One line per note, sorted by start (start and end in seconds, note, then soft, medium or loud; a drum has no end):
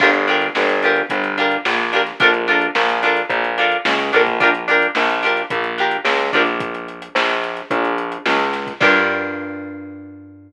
0.00 0.49 G1 loud
0.00 0.10 D4 loud
0.00 0.10 F4 loud
0.00 0.10 G4 loud
0.00 0.10 A#4 medium
0.00 kick medium
0.00 crash loud
0.13 closed hi-hat medium
0.27 0.47 D4 medium
0.27 0.47 F4 medium
0.27 0.47 G4 medium
0.27 0.47 A#4 medium
0.27 snare soft
0.27 closed hi-hat medium
0.41 snare soft
0.41 closed hi-hat medium
0.55 1.03 G1 medium
0.55 snare medium
0.69 closed hi-hat medium
0.82 1.02 D4 medium
0.82 1.02 F4 medium
0.82 1.02 G4 medium
0.82 1.02 A#4 medium
0.82 closed hi-hat medium
0.96 closed hi-hat medium
1.10 1.57 G1 medium
1.10 kick medium
1.10 closed hi-hat medium
1.24 closed hi-hat medium
1.38 1.57 D4 medium
1.38 1.57 F4 medium
1.38 1.57 G4 medium
1.38 1.57 A#4 medium
1.38 snare soft
1.38 closed hi-hat medium
1.51 closed hi-hat medium
1.65 2.12 A#1 medium
1.65 snare medium
1.79 closed hi-hat medium
1.93 2.02 D4 medium
1.93 2.02 F4 medium
1.93 2.02 G4 medium
1.93 2.02 A#4 medium
1.93 snare soft
1.93 closed hi-hat medium
2.06 snare soft
2.06 closed hi-hat medium
2.20 2.68 A#1 medium
2.20 2.30 D4 loud
2.20 2.30 F4 loud
2.20 2.30 A4 loud
2.20 2.30 A#4 loud
2.20 kick loud
2.20 closed hi-hat medium
2.34 closed hi-hat medium
2.48 2.67 D4 loud
2.48 2.67 F4 medium
2.48 2.67 A4 medium
2.48 2.67 A#4 medium
2.48 closed hi-hat medium
2.61 closed hi-hat medium
2.75 3.22 A#1 medium
2.75 snare medium
2.89 closed hi-hat medium
3.03 3.22 D4 medium
3.03 3.22 F4 loud
3.03 3.22 A4 medium
3.03 3.22 A#4 medium
3.03 closed hi-hat medium
3.17 closed hi-hat medium
3.29 3.76 A#1 medium
3.29 kick medium
3.29 closed hi-hat medium
3.44 closed hi-hat medium
3.58 3.77 D4 medium
3.58 3.77 F4 medium
3.58 3.77 A4 medium
3.58 3.77 A#4 medium
3.58 closed hi-hat medium
3.72 closed hi-hat medium
3.85 4.11 C#2 medium
3.85 snare loud
3.99 closed hi-hat medium
4.13 4.88 A#1 medium
4.13 4.22 D4 medium
4.13 4.22 F4 medium
4.13 4.22 A4 medium
4.13 4.22 A#4 medium
4.13 snare soft
4.13 closed hi-hat medium
4.27 kick medium
4.27 closed hi-hat medium
4.40 4.50 D4 loud
4.40 4.50 F4 loud
4.40 4.50 G4 loud
4.40 4.50 A#4 loud
4.40 kick medium
4.40 closed hi-hat medium
4.55 closed hi-hat medium
4.68 4.87 D4 medium
4.68 4.87 F4 medium
4.68 4.87 G4 medium
4.68 4.87 A#4 medium
4.68 closed hi-hat medium
4.82 closed hi-hat medium
4.95 5.43 A#1 medium
4.95 snare medium
5.09 closed hi-hat medium
5.23 5.42 D4 medium
5.23 5.42 F4 medium
5.23 5.42 G4 medium
5.23 5.42 A#4 medium
5.23 closed hi-hat medium
5.37 closed hi-hat medium
5.50 5.98 A#1 medium
5.50 kick medium
5.50 closed hi-hat medium
5.64 closed hi-hat medium
5.78 5.97 D4 medium
5.78 5.97 F4 medium
5.78 5.97 G4 medium
5.78 5.97 A#4 medium
5.78 closed hi-hat medium
5.91 closed hi-hat medium
6.05 6.31 C#2 medium
6.05 snare medium
6.19 closed hi-hat medium
6.33 7.09 A#1 medium
6.33 6.43 D4 loud
6.33 6.43 F4 medium
6.33 6.43 G4 medium
6.33 6.43 A#4 medium
6.33 kick medium
6.33 snare soft
6.33 closed hi-hat medium
6.46 snare soft
6.46 closed hi-hat medium
6.60 kick medium
6.60 closed hi-hat medium
6.75 closed hi-hat medium
6.88 closed hi-hat medium
7.02 closed hi-hat medium
7.15 7.62 A#1 medium
7.15 snare loud
7.29 closed hi-hat medium
7.44 closed hi-hat medium
7.57 closed hi-hat medium
7.71 8.18 A#1 medium
7.71 kick medium
7.71 closed hi-hat medium
7.85 closed hi-hat medium
7.98 closed hi-hat medium
8.12 closed hi-hat medium
8.26 8.73 C#2 medium
8.26 snare medium
8.39 closed hi-hat medium
8.53 snare medium
8.53 closed hi-hat medium
8.67 kick medium
8.67 closed hi-hat medium
8.81 10.52 G2 loud
8.81 10.52 D4 loud
8.81 10.52 F4 loud
8.81 10.52 G4 medium
8.81 10.52 A#4 loud
8.81 kick loud
8.81 crash loud